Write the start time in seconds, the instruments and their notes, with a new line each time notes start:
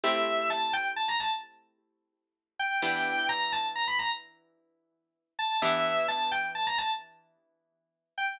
0.03 acoustic guitar (steel) A3 C4 E4 G4, distortion guitar E5
0.50 distortion guitar A5
0.73 distortion guitar G5
0.96 distortion guitar A5
1.08 distortion guitar A#5
1.20 distortion guitar A5
2.59 distortion guitar G5
2.82 acoustic guitar (steel) E3 B3 D4 G4, distortion guitar G5
3.29 distortion guitar A#5
3.52 distortion guitar A5
3.76 distortion guitar A#5
3.87 distortion guitar B5
3.99 distortion guitar A#5
5.39 distortion guitar A5
5.62 acoustic guitar (steel) E3 B3 D4 G4, distortion guitar E5
6.08 distortion guitar A5
6.31 distortion guitar G5
6.55 distortion guitar A5
6.67 distortion guitar A#5
6.78 distortion guitar A5
8.18 distortion guitar G5